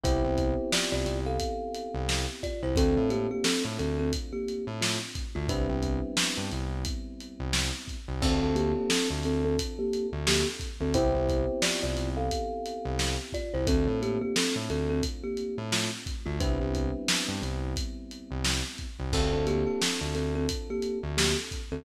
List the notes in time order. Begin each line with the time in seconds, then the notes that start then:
0.04 C2 B3 C4 E4 G4 C5, kick, closed hi-hat
0.24 C2
0.38 kick, closed hi-hat
0.72 F4 D5, snare
0.92 C2 F4 D5
1.06 C2, snare, closed hi-hat
1.26 A4 F5
1.40 kick, closed hi-hat
1.74 closed hi-hat
1.94 C2
2.09 snare
2.43 F4 D5, kick, closed hi-hat
2.63 C2 E4 C5
2.76 D2 A3 C4 D4 F4 A4, kick, closed hi-hat
2.97 A2
3.10 A#3 G4, closed hi-hat
3.31 A#3 G4
3.44 C4 A4, snare
3.65 A2
3.79 D2 C4 A4, closed hi-hat
3.99 C4 A4
4.13 kick, closed hi-hat
4.33 A#3 G4
4.48 closed hi-hat
4.67 A2
4.81 A3 F4, snare
5.15 kick, closed hi-hat
5.35 D2 A3 F4
5.49 C2 G3 B3 C4 D4 E4 B4, kick, closed hi-hat
5.69 C2
5.83 kick, closed hi-hat
6.17 snare
6.37 G2
6.52 C2, closed hi-hat
6.85 kick, closed hi-hat
7.20 closed hi-hat
7.40 C2
7.53 snare
7.88 kick, closed hi-hat
8.08 C2
8.22 D2 C4 D4 F4 A4, kick, crash
8.42 D2
8.55 A#3 G4, closed hi-hat
8.76 A#3 G4
8.89 C4 A4, snare
9.10 D2
9.23 D2 C4 A4, snare, closed hi-hat
9.45 C4 A4
9.59 kick, closed hi-hat
9.79 A#3 G4
9.93 closed hi-hat
10.12 D2
10.27 A#3 G4, snare
10.60 kick, closed hi-hat
10.81 D2 C4 A4
10.94 C2 B3 C4 E4 G4 C5, kick, closed hi-hat
11.15 C2
11.29 kick, closed hi-hat
11.62 F4 D5, snare
11.83 C2 F4 D5
11.97 C2, snare, closed hi-hat
12.17 A4 F5
12.31 kick, closed hi-hat
12.66 closed hi-hat
12.85 C2
12.99 snare
13.33 F4 D5, kick, closed hi-hat
13.54 C2 E4 C5
13.67 D2 A3 C4 D4 F4 A4, kick, closed hi-hat
13.87 A2
14.02 A#3 G4, closed hi-hat
14.21 A#3 G4
14.36 C4 A4, snare
14.56 A2
14.70 D2 C4 A4, closed hi-hat
14.90 C4 A4
15.03 kick, closed hi-hat
15.24 A#3 G4
15.37 closed hi-hat
15.58 A2
15.72 A3 F4, snare
16.06 kick, closed hi-hat
16.26 D2 A3 F4
16.40 C2 G3 B3 C4 D4 E4 B4, kick, closed hi-hat
16.60 C2
16.75 kick, closed hi-hat
17.08 snare
17.28 G2
17.42 C2, closed hi-hat
17.76 kick, closed hi-hat
18.11 closed hi-hat
18.31 C2
18.44 snare
18.78 kick, closed hi-hat
18.99 C2
19.13 D2 C4 D4 F4 A4, kick, crash
19.33 D2
19.47 A#3 G4, closed hi-hat
19.67 A#3 G4
19.81 C4 A4, snare
20.01 D2
20.14 D2 C4 A4, snare, closed hi-hat
20.35 C4 A4
20.49 kick, closed hi-hat
20.70 A#3 G4
20.82 closed hi-hat
21.03 D2
21.17 A#3 G4, snare
21.51 kick, closed hi-hat
21.72 D2 C4 A4